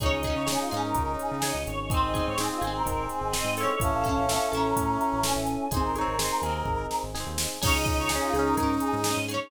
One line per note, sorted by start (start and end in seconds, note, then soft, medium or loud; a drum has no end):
0.00 0.10 C#2 medium
0.00 0.43 C#4 loud
0.00 1.56 D#4 loud
0.00 0.43 D#4 medium
0.00 0.22 D#4 loud
0.00 0.43 G#4 medium
0.00 0.22 G#4 medium
0.00 0.11 C#5 medium
0.00 1.89 C#5 medium
0.00 1.89 D#5 medium
0.00 1.89 G#5 medium
0.00 kick medium
0.00 closed hi-hat medium
0.06 0.22 C#4 loud
0.12 0.33 C#2 medium
0.12 0.23 D#5 medium
0.23 0.46 G#4 medium
0.23 0.35 D#5 medium
0.23 kick medium
0.23 closed hi-hat medium
0.27 0.46 C#4 medium
0.27 0.46 D#4 medium
0.36 0.57 C#3 medium
0.36 0.47 C#5 medium
0.47 0.90 C#4 medium
0.47 0.90 D#4 medium
0.47 0.69 D#4 medium
0.47 0.69 G#4 medium
0.47 0.90 G#4 medium
0.47 0.59 G#4 medium
0.47 snare medium
0.52 0.69 C#4 medium
0.60 0.71 F4 medium
0.71 0.94 G#2 medium
0.71 1.37 D#4 medium
0.71 1.37 G#4 medium
0.71 0.83 G#4 medium
0.71 closed hi-hat medium
0.77 1.37 C#4 medium
0.83 1.13 A#4 medium
0.95 1.17 C#2 medium
0.95 1.38 C#4 medium
0.95 1.38 D#4 medium
0.95 1.38 G#4 medium
0.95 kick medium
0.95 closed hi-hat medium
1.19 1.30 G#4 medium
1.19 closed hi-hat medium
1.31 1.53 C#3 medium
1.31 1.42 G#4 medium
1.42 1.86 C#4 medium
1.42 1.86 D#4 medium
1.42 1.86 G#4 medium
1.42 1.63 D#5 medium
1.42 snare medium
1.48 1.86 C#4 medium
1.54 1.65 C#2 medium
1.67 2.01 G#1 loud
1.67 1.78 C#5 medium
1.67 closed hi-hat medium
1.79 1.90 C#5 medium
1.89 2.33 C4 loud
1.89 3.73 C4 loud
1.89 2.33 D#4 loud
1.89 2.33 G#4 loud
1.89 2.13 G#4 medium
1.89 3.78 C5 medium
1.89 2.01 C5 medium
1.89 3.78 D#5 medium
1.89 3.78 G#5 medium
1.89 kick medium
1.89 closed hi-hat medium
1.94 2.13 C4 medium
1.94 2.13 D#4 medium
2.02 2.23 G#1 medium
2.02 2.14 D#5 medium
2.14 2.36 D#4 medium
2.14 2.36 G#4 medium
2.14 2.25 D#5 medium
2.14 kick medium
2.14 closed hi-hat medium
2.19 2.36 C4 medium
2.26 2.49 G#2 medium
2.26 2.37 C#5 medium
2.38 2.81 C4 medium
2.38 2.81 D#4 medium
2.38 2.60 D#4 medium
2.38 2.60 G#4 medium
2.38 2.50 G#4 medium
2.38 2.81 G#4 medium
2.38 snare medium
2.43 2.60 C4 medium
2.50 2.62 F4 medium
2.61 2.83 G#1 medium
2.61 3.27 D#4 medium
2.61 3.27 G#4 medium
2.61 2.73 G#4 medium
2.61 closed hi-hat medium
2.67 3.27 C4 medium
2.74 3.06 A#4 medium
2.86 3.08 G#1 medium
2.86 3.28 C4 medium
2.86 3.28 D#4 medium
2.86 3.28 G#4 medium
2.86 kick medium
2.86 closed hi-hat medium
3.09 3.21 G#4 medium
3.09 closed hi-hat medium
3.21 3.43 G#1 medium
3.21 3.33 G#4 medium
3.33 3.76 C4 medium
3.33 3.76 D#4 medium
3.33 3.55 D#4 medium
3.33 3.55 G#4 medium
3.33 3.76 G#4 medium
3.33 3.53 D#5 medium
3.33 snare medium
3.38 3.55 C4 medium
3.44 3.66 G#2 medium
3.57 4.03 E4 medium
3.57 4.03 A4 medium
3.57 3.68 C#5 medium
3.57 open hi-hat medium
3.63 4.03 C#4 medium
3.69 3.80 C#5 medium
3.80 3.91 A1 loud
3.80 5.34 C#4 loud
3.80 4.24 C#4 medium
3.80 4.24 E4 loud
3.80 4.24 A4 loud
3.80 5.69 C#5 medium
3.80 5.69 E5 medium
3.80 4.47 F5 medium
3.80 5.69 A5 medium
3.80 4.47 A5 medium
3.80 kick medium
3.80 closed hi-hat medium
3.93 4.14 A1 medium
4.04 4.26 E4 medium
4.04 4.26 A4 medium
4.04 kick medium
4.04 closed hi-hat medium
4.09 4.26 C#4 medium
4.17 4.38 A1 medium
4.28 4.71 C#4 medium
4.28 4.71 E4 medium
4.28 4.51 E4 medium
4.28 4.71 A4 medium
4.28 4.51 A4 medium
4.28 snare medium
4.34 4.51 C#4 medium
4.52 4.74 A1 medium
4.52 5.18 E4 medium
4.52 5.18 A4 medium
4.52 5.20 A#5 medium
4.52 closed hi-hat medium
4.57 5.18 C#4 medium
4.76 4.98 A2 medium
4.76 5.19 C#4 medium
4.76 5.19 E4 medium
4.76 5.19 A4 medium
4.76 kick medium
4.76 closed hi-hat medium
5.01 closed hi-hat medium
5.12 5.34 A1 medium
5.23 5.67 C#4 medium
5.23 5.67 E4 loud
5.23 5.68 E4 medium
5.23 5.67 A4 medium
5.23 5.68 A4 medium
5.23 5.70 G#5 medium
5.23 snare medium
5.29 5.68 C#4 medium
5.36 5.57 A1 medium
5.47 closed hi-hat medium
5.71 5.82 G#1 medium
5.71 6.14 C4 medium
5.71 6.14 D#4 loud
5.71 5.93 D#4 medium
5.71 5.93 G#4 medium
5.71 5.83 G#4 medium
5.71 6.14 G#4 medium
5.71 5.95 C5 loud
5.71 7.62 C5 medium
5.71 7.62 D#5 medium
5.71 7.62 G#5 medium
5.71 kick medium
5.71 closed hi-hat medium
5.77 5.93 C4 medium
5.83 6.05 G#1 medium
5.83 7.00 A#4 medium
5.95 6.18 D#4 medium
5.95 6.18 G#4 medium
5.95 6.17 C#5 medium
5.95 closed hi-hat medium
6.01 6.18 C4 medium
6.08 6.29 G#1 medium
6.19 6.62 C4 medium
6.19 6.62 D#4 medium
6.19 6.41 D#4 medium
6.19 6.41 G#4 medium
6.19 6.62 G#4 medium
6.19 6.40 C5 medium
6.19 snare medium
6.24 6.41 C4 medium
6.42 6.63 D#2 medium
6.42 7.09 D#4 medium
6.42 7.09 G#4 medium
6.42 6.86 A#4 medium
6.42 closed hi-hat medium
6.49 7.09 C4 medium
6.65 6.87 G#1 medium
6.65 7.10 C4 medium
6.65 7.10 D#4 medium
6.65 7.10 G#4 medium
6.65 kick medium
6.91 snare medium
7.03 7.24 G#1 medium
7.14 7.57 C4 medium
7.14 7.57 D#4 medium
7.14 7.58 D#4 medium
7.14 7.57 G#4 medium
7.14 7.58 G#4 medium
7.14 snare medium
7.20 7.58 C4 medium
7.26 7.47 D#2 medium
7.38 snare medium
7.61 7.73 C#2 loud
7.61 9.49 C#4 medium
7.61 9.33 C#4 loud
7.61 9.49 D#4 medium
7.61 9.33 D#4 medium
7.61 9.19 D#4 loud
7.61 8.05 D#4 loud
7.61 9.49 G#4 medium
7.61 8.05 G#4 medium
7.61 9.33 G#4 loud
7.61 7.73 C#5 loud
7.61 kick medium
7.61 crash loud
7.67 8.05 C#4 loud
7.73 7.95 C#2 loud
7.73 7.85 D#5 medium
7.86 7.97 D#5 medium
7.86 kick medium
7.86 closed hi-hat medium
7.97 8.19 C#2 medium
7.97 8.09 C#5 medium
8.09 8.32 D#4 medium
8.09 8.21 G#4 medium
8.09 8.32 G#4 medium
8.09 snare medium
8.15 8.32 C#4 medium
8.22 8.33 F4 medium
8.33 8.55 C#2 medium
8.33 8.55 D#4 medium
8.33 8.45 G#4 medium
8.33 8.55 G#4 medium
8.33 closed hi-hat medium
8.39 8.55 C#4 medium
8.46 8.75 A#4 medium
8.57 8.79 G#2 medium
8.57 9.01 D#4 medium
8.57 9.01 G#4 medium
8.57 kick medium
8.57 closed hi-hat medium
8.63 9.01 C#4 medium
8.80 8.92 G#4 medium
8.80 closed hi-hat medium
8.93 9.14 G#2 medium
8.93 9.04 G#4 medium
9.04 9.27 D#4 medium
9.04 9.27 G#4 medium
9.04 9.25 D#5 medium
9.04 snare medium
9.10 9.27 C#4 medium
9.17 9.38 G#2 medium
9.28 9.50 D#4 medium
9.28 9.50 G#4 medium
9.28 9.40 C#5 medium
9.28 closed hi-hat medium
9.34 9.50 C#4 medium
9.41 9.51 C#5 medium